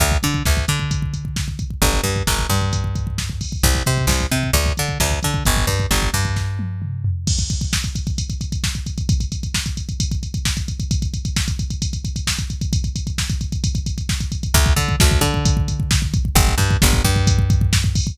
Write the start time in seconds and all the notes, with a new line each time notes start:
0.00 D2, kick, closed hi-hat
0.12 kick
0.23 D3, kick, closed hi-hat
0.34 kick
0.45 D2, kick, snare
0.57 kick
0.68 D3, kick, closed hi-hat
0.79 kick
0.91 kick, closed hi-hat
1.02 kick
1.13 kick, closed hi-hat
1.25 kick
1.36 kick, snare
1.48 kick
1.59 kick, closed hi-hat
1.70 kick
1.82 G1, kick, closed hi-hat
1.93 kick
2.04 G2, kick, closed hi-hat
2.16 kick
2.27 G1, kick, snare
2.39 kick
2.50 G2, kick, closed hi-hat
2.61 kick
2.73 kick, closed hi-hat
2.84 kick
2.95 kick, closed hi-hat
3.07 kick
3.18 kick, snare
3.30 kick
3.41 kick, open hi-hat
3.52 kick
3.63 C2, kick, closed hi-hat
3.75 kick
3.86 C3, kick, closed hi-hat
3.98 kick
4.07 C2, kick, snare
4.20 kick
4.31 C3, kick, closed hi-hat
4.43 kick
4.53 D2, kick, closed hi-hat
4.66 kick
4.77 D3, kick, closed hi-hat
4.89 kick
5.00 D2, kick, snare
5.11 kick
5.23 D3, kick, closed hi-hat
5.34 kick
5.45 G1, kick, closed hi-hat
5.57 kick
5.67 G2, kick, closed hi-hat
5.80 kick
5.91 G1, kick, snare
6.02 kick
6.14 G2, kick, closed hi-hat
6.25 kick
6.36 kick, snare
6.59 high tom
6.82 mid tom
7.04 floor tom
7.27 kick, crash
7.39 kick, closed hi-hat
7.50 kick, closed hi-hat
7.61 kick, closed hi-hat
7.73 kick, snare
7.84 kick, closed hi-hat
7.95 kick, closed hi-hat
8.07 kick, closed hi-hat
8.18 kick, closed hi-hat
8.30 kick, closed hi-hat
8.41 kick, closed hi-hat
8.52 kick, closed hi-hat
8.64 kick, snare
8.75 kick, closed hi-hat
8.86 kick, closed hi-hat
8.98 kick, closed hi-hat
9.09 kick, closed hi-hat
9.20 kick, closed hi-hat
9.32 kick, closed hi-hat
9.43 kick, closed hi-hat
9.54 kick, snare
9.66 kick, closed hi-hat
9.77 kick, closed hi-hat
9.89 kick, closed hi-hat
10.00 kick, closed hi-hat
10.11 kick, closed hi-hat
10.23 kick, closed hi-hat
10.34 kick, closed hi-hat
10.45 kick, snare
10.57 kick, closed hi-hat
10.68 kick, closed hi-hat
10.80 kick, closed hi-hat
10.91 kick, closed hi-hat
11.02 kick, closed hi-hat
11.14 kick, closed hi-hat
11.25 kick, closed hi-hat
11.36 kick, snare
11.48 kick, closed hi-hat
11.59 kick, closed hi-hat
11.70 kick, closed hi-hat
11.82 kick, closed hi-hat
11.93 kick, closed hi-hat
12.05 kick, closed hi-hat
12.16 kick, closed hi-hat
12.27 kick, snare
12.39 kick, closed hi-hat
12.50 kick, closed hi-hat
12.61 kick, closed hi-hat
12.73 kick, closed hi-hat
12.84 kick, closed hi-hat
12.96 kick, closed hi-hat
13.07 kick, closed hi-hat
13.18 kick, snare
13.29 kick, closed hi-hat
13.41 kick, closed hi-hat
13.52 kick, closed hi-hat
13.64 kick, closed hi-hat
13.75 kick, closed hi-hat
13.86 kick, closed hi-hat
13.98 kick, closed hi-hat
14.09 kick, snare
14.20 kick, closed hi-hat
14.32 kick, closed hi-hat
14.43 kick, closed hi-hat
14.54 D2, kick, closed hi-hat
14.66 kick
14.76 D3, kick, closed hi-hat
14.89 kick
15.00 D2, kick, snare
15.11 kick
15.21 D3, kick, closed hi-hat
15.34 kick
15.45 kick, closed hi-hat
15.57 kick
15.68 kick, closed hi-hat
15.80 kick
15.91 kick, snare
16.02 kick
16.14 kick, closed hi-hat
16.25 kick
16.35 G1, kick, closed hi-hat
16.48 kick
16.58 G2, kick, closed hi-hat
16.71 kick
16.82 G1, kick, snare
16.93 kick
17.04 G2, kick, closed hi-hat
17.16 kick
17.27 kick, closed hi-hat
17.39 kick
17.50 kick, closed hi-hat
17.61 kick
17.73 kick, snare
17.84 kick
17.95 kick, open hi-hat
18.07 kick